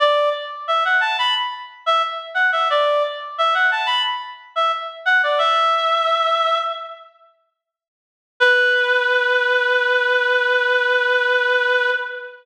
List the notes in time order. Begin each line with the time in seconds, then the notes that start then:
0.00 D5
0.68 E5
0.85 F#5
1.01 A5
1.19 B5
1.86 E5
2.35 F#5
2.52 E5
2.70 D5
3.38 E5
3.54 F#5
3.71 A5
3.86 B5
4.56 E5
5.05 F#5
5.23 D5
5.38 E5
8.40 B4